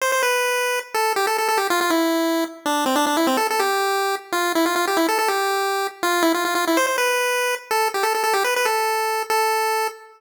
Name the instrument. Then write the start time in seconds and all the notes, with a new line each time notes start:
lead 1 (square)
0.01 C5
0.12 C5
0.23 B4
0.94 A4
1.16 G4
1.27 A4
1.38 A4
1.49 A4
1.57 G4
1.70 F4
1.81 F4
1.90 E4
2.66 D4
2.86 C4
2.96 D4
3.07 D4
3.17 E4
3.27 C4
3.37 A4
3.50 A4
3.60 G4
4.32 F4
4.55 E4
4.66 F4
4.76 F4
4.87 G4
4.97 E4
5.08 A4
5.19 A4
5.28 G4
6.03 F4
6.23 E4
6.34 F4
6.45 F4
6.55 F4
6.67 E4
6.77 C5
6.87 C5
6.98 B4
7.71 A4
7.94 G4
8.03 A4
8.15 A4
8.24 A4
8.33 G4
8.44 B4
8.56 B4
8.65 A4
9.30 A4